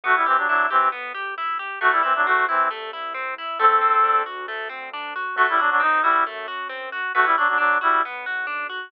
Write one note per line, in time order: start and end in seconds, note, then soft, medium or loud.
0.04 1.67 G1 loud
0.04 0.15 A3 medium
0.04 0.24 B3 medium
0.04 0.15 F#4 medium
0.16 0.26 G3 medium
0.16 0.26 E4 medium
0.26 0.37 E3 medium
0.26 0.37 C4 medium
0.26 0.46 G4 medium
0.37 0.48 F#3 medium
0.37 0.48 D4 medium
0.48 0.66 F#3 medium
0.48 0.66 D4 medium
0.48 0.69 E4 medium
0.70 0.89 E3 medium
0.70 0.89 C4 medium
0.70 0.90 G4 medium
0.92 1.12 B3 medium
1.14 1.34 G4 medium
1.38 1.58 E4 medium
1.59 1.79 G4 medium
1.81 3.45 C2 loud
1.81 1.91 A3 medium
1.81 2.01 A3 loud
1.81 1.91 F#4 medium
1.92 2.02 G3 medium
1.92 2.02 E4 medium
2.03 2.13 E3 medium
2.03 2.13 C4 medium
2.03 2.23 E4 medium
2.16 2.26 F#3 medium
2.16 2.26 D4 medium
2.26 2.45 A3 medium
2.26 2.47 C4 medium
2.26 2.45 F#4 medium
2.49 2.68 E3 medium
2.49 2.68 C4 medium
2.49 2.69 E4 medium
2.71 2.91 A3 medium
2.93 3.13 E4 medium
3.14 3.34 C4 medium
3.38 3.58 E4 medium
3.59 5.23 D2 loud
3.59 3.79 A3 loud
3.59 4.22 C4 medium
3.59 4.22 A4 medium
3.81 4.01 C4 medium
4.04 4.24 D4 medium
4.26 4.46 F#4 medium
4.48 4.68 A3 medium
4.69 4.89 C4 medium
4.93 5.13 D4 medium
5.16 5.36 F#4 medium
5.36 7.00 F#2 loud
5.36 5.47 A3 medium
5.36 5.58 A3 loud
5.36 5.47 F#4 medium
5.49 5.60 G3 medium
5.49 5.60 E4 medium
5.58 5.70 F#3 medium
5.58 5.70 D4 medium
5.58 5.78 F#4 medium
5.71 5.81 F#3 medium
5.71 5.81 D4 medium
5.80 6.00 C4 medium
5.80 6.02 D#4 medium
6.02 6.24 G3 medium
6.02 6.24 E4 medium
6.02 6.24 F#4 medium
6.26 6.46 A3 medium
6.48 6.68 F#4 medium
6.69 6.89 C4 medium
6.92 7.12 F#4 medium
7.15 8.79 B1 loud
7.15 7.25 A3 medium
7.15 7.35 B3 medium
7.15 7.25 F#4 medium
7.25 7.36 G3 medium
7.25 7.36 E4 medium
7.37 7.48 F#3 medium
7.37 7.48 D4 medium
7.37 7.58 F#4 medium
7.48 7.58 F#3 medium
7.48 7.58 D4 medium
7.58 7.78 F#3 medium
7.58 7.78 D4 medium
7.81 8.02 G3 medium
7.81 8.02 E4 medium
7.81 8.01 F#4 medium
8.05 8.25 B3 medium
8.26 8.46 F#4 medium
8.47 8.67 D4 medium
8.70 8.90 F#4 medium